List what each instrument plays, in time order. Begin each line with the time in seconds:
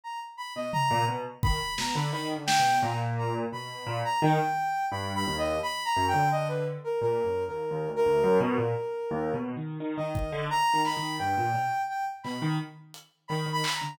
0.04 ocarina A#5
0.37 ocarina B5
0.56 acoustic grand piano B2, ocarina D#5
0.73 ocarina A#5, floor tom
0.91 acoustic grand piano A#2
1.09 acoustic grand piano B2
1.43 acoustic grand piano D#3, ocarina B5, kick
1.78 acoustic grand piano B2, ocarina A#5, snare
1.95 acoustic grand piano D3, ocarina B5
2.12 acoustic grand piano D#3, ocarina B5
2.36 acoustic grand piano D3
2.46 ocarina G5, snare
2.59 acoustic grand piano B2
2.83 acoustic grand piano A#2, ocarina A#5
3.18 ocarina A#5
3.52 acoustic grand piano B2, ocarina B5
3.87 acoustic grand piano A#2
4.05 ocarina A#5
4.22 acoustic grand piano D#3, ocarina G5
4.91 acoustic grand piano G2, ocarina B5
5.15 ocarina B5
5.27 acoustic grand piano D#2
5.38 ocarina D#5
5.63 ocarina B5
5.85 ocarina A#5
5.96 acoustic grand piano F#2
6.08 ocarina G5
6.14 acoustic grand piano D3
6.32 ocarina D#5
6.48 ocarina B4
6.84 ocarina A#4
7.01 acoustic grand piano A#2, ocarina A#4
7.24 acoustic grand piano F#2
7.48 acoustic grand piano D#2, ocarina A#4
7.71 acoustic grand piano D#2
7.88 acoustic grand piano D2
7.96 ocarina A#4
8.06 acoustic grand piano D2
8.24 acoustic grand piano F#2
8.40 acoustic grand piano B2, ocarina A#4
8.58 acoustic grand piano A#2
9.11 acoustic grand piano D#2
9.34 acoustic grand piano B2
9.57 acoustic grand piano D#3
9.80 acoustic grand piano D#3
9.97 acoustic grand piano D#3, ocarina D#5
10.15 acoustic grand piano D#3, kick
10.32 acoustic grand piano D3
10.50 acoustic grand piano D#3, ocarina A#5
10.73 acoustic grand piano D#3
10.85 ocarina B5, snare
10.97 acoustic grand piano D#3
11.19 acoustic grand piano G2, ocarina G5
11.38 acoustic grand piano A#2
11.54 acoustic grand piano B2, cowbell
11.89 ocarina G5
12.23 acoustic grand piano B2, ocarina B5, clap
12.42 acoustic grand piano D#3
12.94 closed hi-hat
13.28 acoustic grand piano D#3, ocarina B5, cowbell
13.46 acoustic grand piano D#3
13.52 ocarina B5
13.64 clap
13.75 ocarina A#5
13.82 acoustic grand piano D3